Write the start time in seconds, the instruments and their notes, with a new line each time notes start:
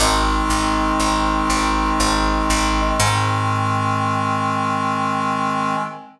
0.00 electric bass (finger) G#1, clarinet D#3 G#3 C4, brass section D#4 D#5
0.50 electric bass (finger) G#1
1.00 electric bass (finger) G#1
1.50 electric bass (finger) G#1
2.00 electric bass (finger) G#1
2.50 electric bass (finger) G#1
3.00 electric bass (finger) G#2, clarinet D#3 G#3 C4, brass section G#5